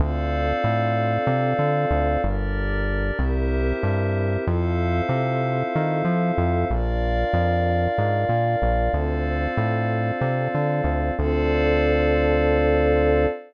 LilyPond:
<<
  \new Staff \with { instrumentName = "Pad 2 (warm)" } { \time 7/8 \key d \minor \tempo 4 = 94 <c' d' f' a'>2.~ <c' d' f' a'>8 | <d' g' bes'>4. <c' e' g' bes'>2 | <c' e' f' a'>2.~ <c' e' f' a'>8 | <d' f' bes'>2.~ <d' f' bes'>8 |
<c' d' f' a'>2.~ <c' d' f' a'>8 | <c' d' f' a'>2.~ <c' d' f' a'>8 | }
  \new Staff \with { instrumentName = "Pad 5 (bowed)" } { \time 7/8 \key d \minor <a' c'' d'' f''>2.~ <a' c'' d'' f''>8 | <g' bes' d''>4. <g' bes' c'' e''>2 | <a' c'' e'' f''>2.~ <a' c'' e'' f''>8 | <bes' d'' f''>2.~ <bes' d'' f''>8 |
<a' c'' d'' f''>2.~ <a' c'' d'' f''>8 | <a' c'' d'' f''>2.~ <a' c'' d'' f''>8 | }
  \new Staff \with { instrumentName = "Synth Bass 1" } { \clef bass \time 7/8 \key d \minor d,4 a,4 c8 d8 d,8 | g,,4. c,4 g,4 | f,4 c4 ees8 f8 f,8 | bes,,4 f,4 aes,8 bes,8 bes,,8 |
d,4 a,4 c8 d8 d,8 | d,2.~ d,8 | }
>>